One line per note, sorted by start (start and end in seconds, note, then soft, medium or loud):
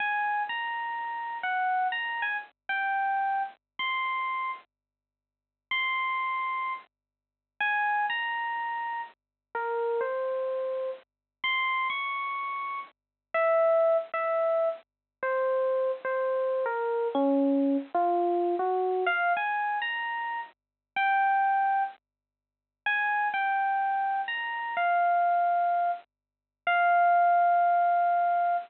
0.00 0.43 G#5 medium
0.49 1.38 A#5 medium
1.43 1.88 F#5 medium
1.92 2.23 A#5 medium
2.22 2.37 G#5 medium
2.69 3.43 G5 medium
3.79 4.51 C6 medium
5.71 6.73 C6 medium
7.60 8.06 G#5 medium
8.10 9.01 A#5 medium
9.55 10.01 A#4 medium
10.01 10.90 C5 medium
11.44 11.88 C6 loud
11.90 12.80 C#6 medium
13.34 13.97 E5 medium
14.14 14.69 E5 medium
15.23 15.91 C5 medium
16.05 16.64 C5 medium
16.66 17.08 A#4 medium
17.15 17.77 C#4 loud
17.94 18.55 F4 medium
18.59 19.04 F#4 medium
19.06 19.33 F5 loud
19.37 19.79 G#5 medium
19.82 20.40 A#5 medium
20.96 21.83 G5 medium
22.86 23.28 G#5 loud
23.34 24.21 G5 medium
24.28 24.75 A#5 medium
24.77 25.91 F5 medium
26.67 28.56 F5 loud